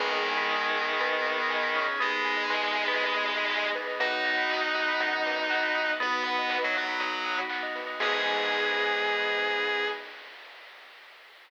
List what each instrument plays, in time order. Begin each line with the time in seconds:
0.00 synth bass 1 G#1, distortion guitar D#3 D#4, tubular bells G#3 B4, vibraphone B3 D#4, pad 5 (bowed) B3 D#4 G#4, kick, crash
0.06 vibraphone G#4
0.12 tubular bells D#5
0.25 tubular bells G#5, open hi-hat
0.37 tubular bells B5
0.49 tubular bells D#6, kick, clap
0.62 tubular bells G#6
0.75 tubular bells D#6, open hi-hat
0.88 tubular bells B5
0.99 synth bass 1 G#1, tubular bells B3 G#5, kick, closed hi-hat
1.13 tubular bells D#5
1.24 tubular bells B4, open hi-hat
1.38 tubular bells D#5
1.50 tubular bells G#5, kick, clap
1.63 tubular bells B5
1.74 tubular bells C#4 D#6, open hi-hat
1.88 tubular bells G#6
2.00 synth bass 1 D#2, distortion guitar G#3 G#4, tubular bells B3 D#6, vibraphone B3 D#4, kick, closed hi-hat
2.06 vibraphone G#4
2.13 tubular bells B5
2.24 tubular bells G#5, open hi-hat
2.37 tubular bells D#5
2.49 tubular bells G#3 B4, kick, clap
2.62 tubular bells D#5
2.74 tubular bells G#5, open hi-hat
2.88 tubular bells B3 B5
3.00 synth bass 1 G#1, tubular bells D#6, kick, closed hi-hat
3.12 tubular bells G#6
3.25 tubular bells D#6, open hi-hat
3.37 tubular bells B5
3.50 tubular bells G#5, kick, clap
3.62 tubular bells D#5
3.74 tubular bells B3 B4, open hi-hat
3.87 tubular bells D#5
4.00 synth bass 1 B1, vibraphone B3 D#4, pad 5 (bowed) B3 D#4 F#4, distortion guitar D#4 D#5, tubular bells F#4 B4, kick, closed hi-hat
4.06 vibraphone F#4
4.13 tubular bells D#5
4.25 tubular bells F#5, open hi-hat
4.37 tubular bells B5
4.50 tubular bells D#6, kick, clap
4.62 tubular bells F#6
4.75 tubular bells F#4 D#6, open hi-hat
4.88 tubular bells B5
5.00 synth bass 1 F#2, tubular bells F#5, kick, closed hi-hat
5.13 tubular bells D#5
5.26 tubular bells B4, open hi-hat
5.38 tubular bells D#5
5.50 tubular bells F#4 F#5, kick, clap
5.63 tubular bells B5
5.74 tubular bells D#6, open hi-hat
5.87 tubular bells F#6
6.00 synth bass 1 B1, tubular bells B3 D#6, vibraphone B3 D#4, distortion guitar B3 B4, kick, closed hi-hat
6.06 vibraphone F#4
6.12 tubular bells B5
6.23 distortion guitar B3 B4, tubular bells F#5, open hi-hat
6.38 tubular bells D#5
6.49 tubular bells B4, kick, snare
6.62 distortion guitar F#3 F#4, tubular bells D#5
6.74 distortion guitar F#3 F#4, tubular bells F#5, open hi-hat
6.88 tubular bells B5
7.00 synth bass 1 B1, tubular bells D#6, kick, closed hi-hat
7.13 tubular bells F#6
7.24 tubular bells D#6, open hi-hat
7.37 tubular bells B5
7.50 tubular bells F#5, kick, clap
7.62 tubular bells D#5
7.75 tubular bells B4, open hi-hat
7.87 tubular bells D#5
8.00 synth bass 1 G#2, tubular bells G#3 B4 D#5 G#5, pad 5 (bowed) B3 D#4 G#4, vibraphone B3 D#4, distortion guitar G#4, kick, crash
8.06 vibraphone G#4